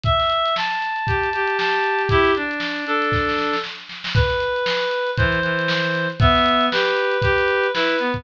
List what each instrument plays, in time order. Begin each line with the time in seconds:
0.03 clarinet E5, kick, closed hi-hat
0.20 snare, closed hi-hat
0.30 closed hi-hat
0.45 snare, closed hi-hat
0.56 clarinet A5, snare
0.71 closed hi-hat
0.81 snare, closed hi-hat
0.96 closed hi-hat
1.07 clarinet G4, kick, closed hi-hat
1.23 closed hi-hat
1.33 clarinet G4, closed hi-hat
1.47 closed hi-hat
1.58 clarinet A5, snare
1.73 closed hi-hat
1.84 closed hi-hat
1.98 snare, closed hi-hat
2.09 clarinet E4 G4, kick, closed hi-hat
2.25 snare, closed hi-hat
2.35 clarinet D4, closed hi-hat
2.51 closed hi-hat
2.60 snare
2.76 closed hi-hat
2.85 clarinet D4 A4, closed hi-hat
3.02 snare, closed hi-hat
3.12 kick, snare
3.29 snare
3.38 snare
3.53 snare
3.64 snare
3.89 snare
4.04 snare
4.15 clarinet B4, kick, closed hi-hat
4.30 snare, closed hi-hat
4.40 closed hi-hat
4.56 closed hi-hat
4.66 snare
4.82 closed hi-hat
4.91 closed hi-hat
5.07 closed hi-hat
5.17 clarinet E3 C5, kick, closed hi-hat
5.32 closed hi-hat
5.42 clarinet E3, closed hi-hat
5.59 closed hi-hat
5.68 snare
5.84 closed hi-hat
5.95 closed hi-hat
6.10 closed hi-hat
6.19 clarinet B3 E5, kick, closed hi-hat
6.35 snare, closed hi-hat
6.46 closed hi-hat
6.61 closed hi-hat
6.71 clarinet G4 B4, snare
6.86 closed hi-hat
6.97 closed hi-hat
7.11 closed hi-hat
7.22 clarinet G4, kick, closed hi-hat
7.38 closed hi-hat
7.48 closed hi-hat
7.64 closed hi-hat
7.73 clarinet E4 B4, snare
7.89 closed hi-hat
7.99 clarinet B3, closed hi-hat
8.14 kick, closed hi-hat